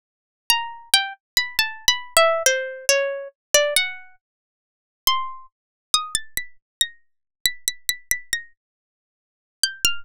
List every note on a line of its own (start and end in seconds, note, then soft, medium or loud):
0.50 0.89 A#5 medium
0.94 1.13 G5 medium
1.37 1.57 B5 medium
1.59 1.85 A5 medium
1.88 2.14 B5 medium
2.17 2.43 E5 medium
2.46 2.85 C5 medium
2.89 3.28 C#5 medium
3.54 3.74 D5 medium
3.76 4.15 F#5 medium
5.07 5.46 C6 loud
5.94 6.14 D#6 medium
6.15 6.34 A6 medium
6.37 6.57 B6 medium
6.81 7.40 A#6 medium
7.45 7.65 B6 medium
7.68 7.87 B6 medium
7.89 8.09 B6 medium
8.11 8.31 B6 medium
8.33 8.53 A#6 medium
9.63 9.83 G6 medium
9.85 10.04 F6 loud